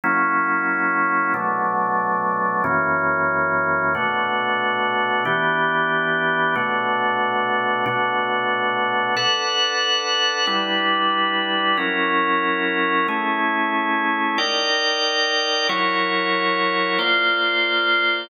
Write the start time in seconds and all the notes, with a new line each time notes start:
0.04 F#3 A#3 C#4 E4
1.34 B2 F#3 A3 D4
2.64 F#2 E3 A#3 C#4
3.95 B2 A3 D4 F#4
5.25 E3 B3 D4 G4
6.56 B2 A3 D4 F#4
7.86 B2 A3 D4 F#4
9.17 D4 A4 B4 F#5
10.47 G3 D4 E4 B4
11.77 F#3 C#4 E4 A#4
13.08 A3 C#4 E4 G#4
14.38 D#4 A#4 D5 G5
15.69 F#3 E4 A#4 C#5
16.99 A#3 F4 C5 D5